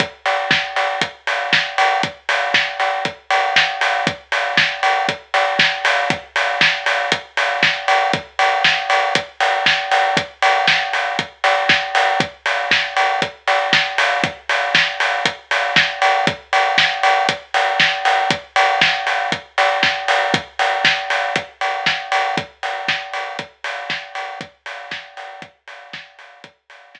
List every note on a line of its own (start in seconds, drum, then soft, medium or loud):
0.00 kick medium
0.00 closed hi-hat loud
0.26 open hi-hat medium
0.51 kick medium
0.51 snare loud
0.76 open hi-hat medium
1.01 kick medium
1.01 closed hi-hat loud
1.27 open hi-hat medium
1.53 kick medium
1.53 snare loud
1.78 open hi-hat medium
2.03 kick medium
2.03 closed hi-hat medium
2.29 open hi-hat medium
2.54 kick medium
2.54 snare loud
2.80 open hi-hat medium
3.05 kick medium
3.05 closed hi-hat medium
3.31 open hi-hat medium
3.56 kick medium
3.56 snare loud
3.81 open hi-hat medium
4.07 kick loud
4.07 closed hi-hat medium
4.32 open hi-hat medium
4.57 kick medium
4.57 snare loud
4.83 open hi-hat medium
5.08 kick medium
5.08 closed hi-hat medium
5.34 open hi-hat medium
5.59 kick medium
5.59 snare loud
5.85 open hi-hat medium
6.10 kick loud
6.10 closed hi-hat loud
6.36 open hi-hat medium
6.61 kick medium
6.61 snare loud
6.86 open hi-hat medium
7.12 kick medium
7.12 closed hi-hat loud
7.37 open hi-hat medium
7.63 kick medium
7.63 snare loud
7.88 open hi-hat medium
8.13 kick loud
8.13 closed hi-hat loud
8.39 open hi-hat medium
8.64 kick medium
8.64 snare loud
8.90 open hi-hat medium
9.15 kick medium
9.15 closed hi-hat loud
9.40 open hi-hat medium
9.66 kick medium
9.66 snare loud
9.91 open hi-hat medium
10.17 kick loud
10.17 closed hi-hat loud
10.42 open hi-hat medium
10.67 kick medium
10.67 snare loud
10.93 open hi-hat medium
11.19 kick medium
11.19 closed hi-hat medium
11.44 open hi-hat medium
11.69 kick medium
11.69 snare loud
11.95 open hi-hat medium
12.20 kick loud
12.20 closed hi-hat medium
12.46 open hi-hat medium
12.71 kick medium
12.71 snare loud
12.97 open hi-hat medium
13.22 kick medium
13.22 closed hi-hat medium
13.47 open hi-hat medium
13.73 kick medium
13.73 snare loud
13.98 open hi-hat medium
14.24 kick loud
14.24 closed hi-hat loud
14.49 open hi-hat medium
14.75 kick medium
14.75 snare loud
15.00 open hi-hat medium
15.25 kick medium
15.25 closed hi-hat loud
15.51 open hi-hat medium
15.76 kick medium
15.76 snare loud
16.02 open hi-hat medium
16.27 kick loud
16.27 closed hi-hat loud
16.53 open hi-hat medium
16.78 kick medium
16.78 snare loud
17.03 open hi-hat medium
17.29 kick medium
17.29 closed hi-hat loud
17.54 open hi-hat medium
17.80 kick medium
17.80 snare loud
18.05 open hi-hat medium
18.30 kick loud
18.30 closed hi-hat loud
18.56 open hi-hat medium
18.81 kick medium
18.81 snare loud
19.07 open hi-hat medium
19.32 kick medium
19.32 closed hi-hat medium
19.58 open hi-hat medium
19.83 kick medium
19.83 snare loud
20.08 open hi-hat medium
20.34 kick loud
20.34 closed hi-hat loud
20.59 open hi-hat medium
20.85 kick medium
20.85 snare loud
21.10 open hi-hat medium
21.36 kick medium
21.36 closed hi-hat loud
21.61 open hi-hat medium
21.86 kick medium
21.86 snare loud
22.12 open hi-hat medium
22.37 kick loud
22.37 closed hi-hat loud
22.63 open hi-hat medium
22.88 kick medium
22.88 snare loud
23.13 open hi-hat medium
23.39 kick medium
23.39 closed hi-hat loud
23.64 open hi-hat medium
23.90 kick medium
23.90 snare loud
24.15 open hi-hat medium
24.41 kick loud
24.41 closed hi-hat medium
24.66 open hi-hat medium
24.91 kick medium
24.91 snare loud
25.17 open hi-hat medium
25.42 kick medium
25.42 closed hi-hat medium
25.68 open hi-hat medium
25.93 kick loud
25.93 snare loud
26.19 open hi-hat medium
26.44 kick loud
26.44 closed hi-hat loud
26.70 open hi-hat medium
26.95 kick medium
26.95 snare loud